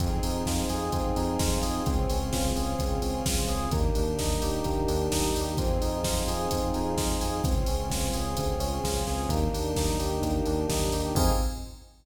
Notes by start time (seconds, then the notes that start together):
0.00 F2 C4 D#4 F4 G#4, kick, closed hi-hat
0.23 F2 D#4, open hi-hat
0.45 F2 F4, kick, snare
0.69 F2 G#4, open hi-hat
0.92 F2 C4, kick, closed hi-hat
1.16 F2 D#4, open hi-hat
1.39 F2 F4, kick, snare
1.62 F2 G#4, open hi-hat
1.86 C#2 C4 C#4 F4 G#4, kick, closed hi-hat
2.09 C#2 C#4, open hi-hat
2.33 C#2 F4, kick, snare
2.55 C#2 G#4, open hi-hat
2.79 C#2 C4, kick, closed hi-hat
3.02 C#2 C#4, open hi-hat
3.26 C#2 F4, kick, snare
3.47 C#2 G#4, open hi-hat
3.71 D#2 A#3 D4 D#4 G4, kick, closed hi-hat
3.95 D#2 D4, open hi-hat
4.19 D#2 D#4, kick, snare
4.42 D#2 G4, open hi-hat
4.64 D#2 A#3, kick, closed hi-hat
4.88 D#2 D4, open hi-hat
5.11 D#2 D#4, kick, snare
5.35 D#2 G4, open hi-hat
5.57 F2 C4 D#4 F4 G#4, kick, closed hi-hat
5.81 F2 D#4, open hi-hat
6.03 F2 F4, kick, snare
6.27 F2 G#4, open hi-hat
6.51 F2 C4, kick, closed hi-hat
6.74 F2 D#4, open hi-hat
6.97 F2 F4, kick, snare
7.21 F2 G#4, open hi-hat
7.44 C#2 C4 C#4 F4 G#4, kick, closed hi-hat
7.66 C#2 C#4, open hi-hat
7.90 C#2 F4, kick, snare
8.13 C#2 G#4, open hi-hat
8.37 D2 C4, kick, closed hi-hat
8.59 C#2 C#4, open hi-hat
8.84 C#2 F4, kick, snare
9.07 C#2 G#4, snare
9.29 D#2 A#3 D4 D#4 G4, kick, closed hi-hat
9.53 D#2 D4, open hi-hat
9.76 D#2 D#4, kick, snare
10.00 D#2 G4, open hi-hat
10.22 D#2 A#3, kick, closed hi-hat
10.46 D#2 D4, open hi-hat
10.69 D#2 D#4, kick, snare
10.92 D#2 G4, open hi-hat
11.15 F2 C4 D#4 F4 G#4, kick, crash